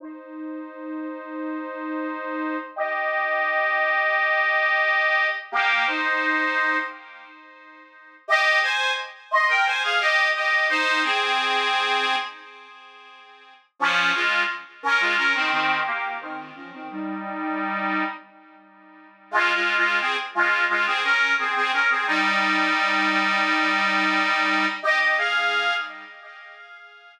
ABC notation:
X:1
M:4/4
L:1/16
Q:1/4=87
K:Fm
V:1 name="Accordion"
[Ec]16 | [Ge]16 | [B,G]2 [Ec]6 z8 | [K:Ab] [Ge]2 [ca]2 z2 [ec'] [Bg] [ca] [Af] [Ge]2 [Ge]2 [Ec]2 |
[CA]8 z8 | [F,D]2 [A,F]2 z2 [DB] [A,F] [DB] [E,C] [E,C]2 [B,G]2 [E,C]2 | [F,D] [E,C] [G,E]8 z6 | [K:Fm] (3[A,F]2 [A,F]2 [A,F]2 [CA] z [A,F]2 [A,F] [CA] [DB]2 [CA] [CA] [DB] [CA] |
[G,E]16 | [Ge] [Ge] [Af]4 z10 |]